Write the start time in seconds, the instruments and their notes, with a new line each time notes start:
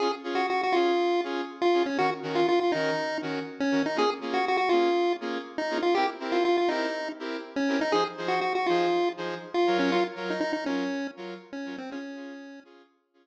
0.00 lead 2 (sawtooth) C#4 F4 G#4, lead 1 (square) G#4
0.24 lead 2 (sawtooth) C#4 F4 G#4
0.35 lead 1 (square) F#4
0.50 lead 1 (square) F#4
0.63 lead 1 (square) F#4
0.72 lead 2 (sawtooth) C#4 F4 G#4, lead 1 (square) F4
1.24 lead 2 (sawtooth) C#4 F4 G#4
1.62 lead 1 (square) F4
1.74 lead 2 (sawtooth) C#4 F4 G#4
1.86 lead 1 (square) C#4
1.98 lead 2 (sawtooth) D#3 C#4 F#4 A#4, lead 1 (square) F#4
2.23 lead 2 (sawtooth) D#3 C#4 F#4 A#4
2.35 lead 1 (square) F4
2.49 lead 1 (square) F4
2.60 lead 1 (square) F4
2.72 lead 2 (sawtooth) D#3 C#4 F#4 A#4, lead 1 (square) D#4
3.22 lead 2 (sawtooth) D#3 C#4 F#4 A#4
3.60 lead 1 (square) C#4
3.71 lead 2 (sawtooth) D#3 C#4 F#4 A#4
3.86 lead 1 (square) D#4
3.96 lead 2 (sawtooth) A#3 C#4 F4 G#4, lead 1 (square) G#4
4.21 lead 2 (sawtooth) A#3 C#4 F4 G#4
4.34 lead 1 (square) F#4
4.48 lead 1 (square) F#4
4.57 lead 1 (square) F#4
4.69 lead 2 (sawtooth) A#3 C#4 F4 G#4, lead 1 (square) F4
5.21 lead 2 (sawtooth) A#3 C#4 F4 G#4
5.58 lead 1 (square) D#4
5.70 lead 2 (sawtooth) A#3 C#4 F4 G#4
5.83 lead 1 (square) F4
5.95 lead 2 (sawtooth) C4 E4 G4 A#4, lead 1 (square) G4
6.20 lead 2 (sawtooth) C4 E4 G4 A#4
6.32 lead 1 (square) F4
6.45 lead 1 (square) F4
6.58 lead 1 (square) F4
6.68 lead 2 (sawtooth) C4 E4 G4 A#4, lead 1 (square) D#4
7.19 lead 2 (sawtooth) C4 E4 G4 A#4
7.56 lead 1 (square) C#4
7.68 lead 2 (sawtooth) C4 E4 G4 A#4
7.81 lead 1 (square) D#4
7.92 lead 2 (sawtooth) F3 D#4 G#4 C5, lead 1 (square) G#4
8.17 lead 2 (sawtooth) F3 D#4 G#4 C5
8.28 lead 1 (square) F#4
8.41 lead 1 (square) F#4
8.55 lead 1 (square) F#4
8.66 lead 2 (sawtooth) F3 D#4 G#4 C5, lead 1 (square) F4
9.17 lead 2 (sawtooth) F3 D#4 G#4 C5
9.54 lead 1 (square) F4
9.67 lead 2 (sawtooth) F#3 F4 A#4 C#5
9.79 lead 1 (square) C#4
9.92 lead 1 (square) F4
10.16 lead 2 (sawtooth) F#3 F4 A#4 C#5
10.30 lead 1 (square) D#4
10.40 lead 1 (square) D#4
10.53 lead 1 (square) D#4
10.66 lead 2 (sawtooth) F#3 F4 A#4 C#5, lead 1 (square) C#4
11.17 lead 2 (sawtooth) F#3 F4 A#4 C#5
11.53 lead 1 (square) C#4
11.65 lead 2 (sawtooth) F#3 F4 A#4 C#5
11.78 lead 1 (square) C4
11.90 lead 2 (sawtooth) C#4 F4 G#4, lead 1 (square) C#4
12.15 lead 2 (sawtooth) C#4 F4 G#4
12.65 lead 2 (sawtooth) C#4 F4 G#4
13.14 lead 2 (sawtooth) C#4 F4 G#4